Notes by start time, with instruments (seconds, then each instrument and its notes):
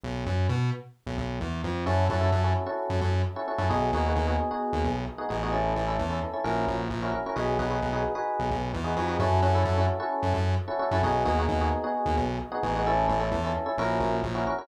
0.04 synth bass 1 B1
0.27 synth bass 1 F#2
0.49 synth bass 1 B2
1.07 synth bass 1 B1
1.18 synth bass 1 B1
1.41 synth bass 1 E2
1.64 synth bass 1 F2
1.86 synth bass 1 F#2, electric piano 1 C#4 E4 F#4 A4
2.10 synth bass 1 F#2, electric piano 1 C#4 E4 F#4 A4
2.21 electric piano 1 C#4 E4 F#4 A4
2.32 synth bass 1 F#2
2.44 electric piano 1 C#4 E4 F#4 A4
2.66 electric piano 1 C#4 E4 F#4 A4
2.90 synth bass 1 F#2
3.01 synth bass 1 F#2
3.36 electric piano 1 C#4 E4 F#4 A4
3.48 electric piano 1 C#4 E4 F#4 A4
3.58 synth bass 1 F#2, electric piano 1 C#4 E4 F#4 A4
3.69 synth bass 1 B1, electric piano 1 B3 D#4 F#4 G#4
3.93 synth bass 1 D#2, electric piano 1 B3 D#4 F#4 G#4
4.06 electric piano 1 B3 D#4 F#4 G#4
4.16 synth bass 1 D#2
4.27 electric piano 1 B3 D#4 F#4 G#4
4.51 electric piano 1 B3 D#4 F#4 G#4
4.73 synth bass 1 D#2
4.84 synth bass 1 B1
5.18 electric piano 1 B3 D#4 F#4 G#4
5.29 synth bass 1 A1, electric piano 1 B3 D#4 F#4 G#4
5.43 electric piano 1 B3 D#4 F#4 G#4
5.52 electric piano 1 C#4 E4 A4
5.76 synth bass 1 A1, electric piano 1 C#4 E4 A4
5.87 electric piano 1 C#4 E4 A4
5.99 synth bass 1 E2
6.10 electric piano 1 C#4 E4 A4
6.33 electric piano 1 C#4 E4 A4
6.44 synth bass 1 A#1, electric piano 1 C#4 E4 F#4 A#4
6.68 synth bass 1 A#1
6.90 synth bass 1 A#1
7.02 electric piano 1 C#4 E4 F#4 A#4
7.12 electric piano 1 C#4 E4 F#4 A#4
7.26 electric piano 1 C#4 E4 F#4 A#4
7.36 synth bass 1 B1, electric piano 1 D#4 F#4 G#4 B4
7.59 synth bass 1 B1, electric piano 1 D#4 F#4 G#4 B4
7.70 electric piano 1 D#4 F#4 G#4 B4
7.82 synth bass 1 B1
7.93 electric piano 1 D#4 F#4 G#4 B4
8.15 electric piano 1 D#4 F#4 G#4 B4
8.40 synth bass 1 B1
8.51 synth bass 1 B1
8.74 synth bass 1 E2
8.84 electric piano 1 D#4 F#4 G#4 B4
8.96 synth bass 1 F2, electric piano 1 D#4 F#4 G#4 B4
9.08 electric piano 1 D#4 F#4 G#4 B4
9.20 synth bass 1 F#2, electric piano 1 C#4 E4 F#4 A4
9.42 synth bass 1 F#2, electric piano 1 C#4 E4 F#4 A4
9.55 electric piano 1 C#4 E4 F#4 A4
9.65 synth bass 1 F#2
9.78 electric piano 1 C#4 E4 F#4 A4
10.00 electric piano 1 C#4 E4 F#4 A4
10.23 synth bass 1 F#2
10.34 synth bass 1 F#2
10.68 electric piano 1 C#4 E4 F#4 A4
10.79 electric piano 1 C#4 E4 F#4 A4
10.91 synth bass 1 F#2, electric piano 1 C#4 E4 F#4 A4
11.03 synth bass 1 B1, electric piano 1 B3 D#4 F#4 G#4
11.25 synth bass 1 D#2, electric piano 1 B3 D#4 F#4 G#4
11.39 electric piano 1 B3 D#4 F#4 G#4
11.49 synth bass 1 D#2
11.61 electric piano 1 B3 D#4 F#4 G#4
11.84 electric piano 1 B3 D#4 F#4 G#4
12.06 synth bass 1 D#2
12.17 synth bass 1 B1
12.52 electric piano 1 B3 D#4 F#4 G#4
12.63 synth bass 1 A1, electric piano 1 B3 D#4 F#4 G#4
12.76 electric piano 1 B3 D#4 F#4 G#4
12.87 electric piano 1 C#4 E4 A4
13.07 synth bass 1 A1, electric piano 1 C#4 E4 A4
13.20 electric piano 1 C#4 E4 A4
13.32 synth bass 1 E2
13.44 electric piano 1 C#4 E4 A4
13.66 electric piano 1 C#4 E4 A4
13.78 synth bass 1 A#1, electric piano 1 C#4 E4 F#4 A#4
14.00 synth bass 1 A#1
14.23 synth bass 1 A#1
14.35 electric piano 1 C#4 E4 F#4 A#4
14.47 electric piano 1 C#4 E4 F#4 A#4
14.58 electric piano 1 C#4 E4 F#4 A#4